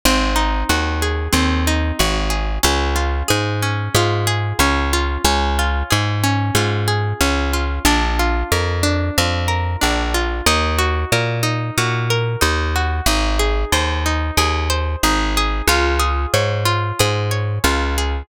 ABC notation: X:1
M:4/4
L:1/8
Q:1/4=92
K:Db
V:1 name="Pizzicato Strings"
C E G A C E G A | D F A D F A D F | D F A D F A D F | =D F B D F B D F |
E G B E G B E G | E A c E A c E A | F A d F A d F A |]
V:2 name="Electric Bass (finger)" clef=bass
A,,,2 E,,2 E,,2 A,,,2 | D,,2 A,,2 A,,2 D,,2 | D,,2 A,,2 A,,2 D,,2 | B,,,2 F,,2 F,,2 B,,,2 |
E,,2 B,,2 B,,2 E,,2 | A,,,2 E,,2 E,,2 A,,,2 | D,,2 A,,2 A,,2 D,,2 |]